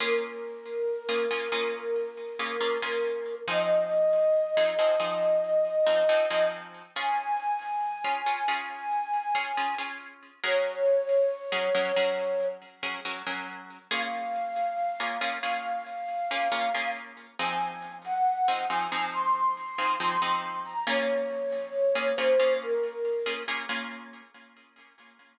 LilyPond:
<<
  \new Staff \with { instrumentName = "Flute" } { \time 4/4 \key bes \minor \tempo 4 = 69 bes'1 | ees''1 | aes''1 | des''2~ des''8 r4. |
f''1 | aes''8. ges''8. aes''8 c'''4 c'''8. bes''16 | des''4. c''8 bes'4 r4 | }
  \new Staff \with { instrumentName = "Orchestral Harp" } { \time 4/4 \key bes \minor <bes des' f' aes'>4~ <bes des' f' aes'>16 <bes des' f' aes'>16 <bes des' f' aes'>16 <bes des' f' aes'>4 <bes des' f' aes'>16 <bes des' f' aes'>16 <bes des' f' aes'>8. | <f c' ees' aes'>4~ <f c' ees' aes'>16 <f c' ees' aes'>16 <f c' ees' aes'>16 <f c' ees' aes'>4 <f c' ees' aes'>16 <f c' ees' aes'>16 <f c' ees' aes'>8. | <des' f' aes'>4~ <des' f' aes'>16 <des' f' aes'>16 <des' f' aes'>16 <des' f' aes'>4 <des' f' aes'>16 <des' f' aes'>16 <des' f' aes'>8. | <ges des' aes' bes'>4~ <ges des' aes' bes'>16 <ges des' aes' bes'>16 <ges des' aes' bes'>16 <ges des' aes' bes'>4 <ges des' aes' bes'>16 <ges des' aes' bes'>16 <ges des' aes' bes'>8. |
<bes des' f' aes'>4~ <bes des' f' aes'>16 <bes des' f' aes'>16 <bes des' f' aes'>16 <bes des' f' aes'>4 <bes des' f' aes'>16 <bes des' f' aes'>16 <bes des' f' aes'>8. | <f c' ees' aes'>4~ <f c' ees' aes'>16 <f c' ees' aes'>16 <f c' ees' aes'>16 <f c' ees' aes'>4 <f c' ees' aes'>16 <f c' ees' aes'>16 <f c' ees' aes'>8. | <bes des' f' aes'>4~ <bes des' f' aes'>16 <bes des' f' aes'>16 <bes des' f' aes'>16 <bes des' f' aes'>4 <bes des' f' aes'>16 <bes des' f' aes'>16 <bes des' f' aes'>8. | }
>>